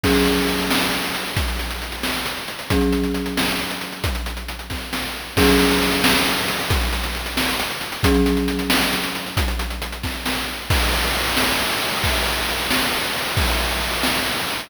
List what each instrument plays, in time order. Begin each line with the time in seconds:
0.04 marimba F#3 C#4 G#4, kick, crash
0.15 closed hi-hat
0.25 closed hi-hat
0.37 closed hi-hat
0.48 closed hi-hat
0.59 closed hi-hat
0.71 snare
0.82 closed hi-hat
0.92 closed hi-hat
1.04 closed hi-hat
1.15 closed hi-hat
1.26 closed hi-hat
1.37 kick, closed hi-hat
1.48 closed hi-hat
1.59 closed hi-hat
1.71 closed hi-hat
1.82 closed hi-hat
1.92 closed hi-hat
2.03 snare
2.14 closed hi-hat
2.26 closed hi-hat
2.37 closed hi-hat
2.48 closed hi-hat
2.59 closed hi-hat
2.70 marimba F#3 C#4 G#4, kick, closed hi-hat
2.81 closed hi-hat
2.92 closed hi-hat
3.04 closed hi-hat
3.14 closed hi-hat
3.26 closed hi-hat
3.37 snare
3.48 closed hi-hat
3.59 closed hi-hat
3.70 closed hi-hat
3.81 closed hi-hat
3.92 closed hi-hat
4.04 kick, closed hi-hat
4.15 closed hi-hat
4.26 closed hi-hat
4.37 closed hi-hat
4.48 closed hi-hat
4.59 closed hi-hat
4.70 kick, snare
4.93 snare
5.37 marimba F#3 C#4 G#4, kick, crash
5.48 closed hi-hat
5.59 closed hi-hat
5.70 closed hi-hat
5.82 closed hi-hat
5.92 closed hi-hat
6.04 snare
6.15 closed hi-hat
6.26 closed hi-hat
6.37 closed hi-hat
6.48 closed hi-hat
6.59 closed hi-hat
6.70 kick, closed hi-hat
6.81 closed hi-hat
6.93 closed hi-hat
7.03 closed hi-hat
7.15 closed hi-hat
7.26 closed hi-hat
7.37 snare
7.48 closed hi-hat
7.60 closed hi-hat
7.70 closed hi-hat
7.81 closed hi-hat
7.92 closed hi-hat
8.03 marimba F#3 C#4 G#4, kick, closed hi-hat
8.14 closed hi-hat
8.26 closed hi-hat
8.37 closed hi-hat
8.48 closed hi-hat
8.59 closed hi-hat
8.70 snare
8.81 closed hi-hat
8.93 closed hi-hat
9.03 closed hi-hat
9.15 closed hi-hat
9.26 closed hi-hat
9.37 kick, closed hi-hat
9.48 closed hi-hat
9.59 closed hi-hat
9.70 closed hi-hat
9.82 closed hi-hat
9.92 closed hi-hat
10.03 kick, snare
10.26 snare
10.70 kick, crash
10.81 ride
10.93 ride
11.04 ride
11.15 ride
11.26 ride
11.37 snare
11.48 ride
11.59 ride
11.70 ride
11.81 ride
11.92 ride
12.04 kick, ride
12.15 ride
12.26 ride
12.37 ride
12.48 ride
12.59 ride
12.70 snare
12.82 ride
12.93 ride
13.04 ride
13.15 ride
13.26 ride
13.37 kick, ride
13.48 ride
13.60 ride
13.71 ride
13.81 ride
13.93 ride
14.03 snare
14.15 ride
14.26 ride
14.37 ride
14.48 ride
14.59 ride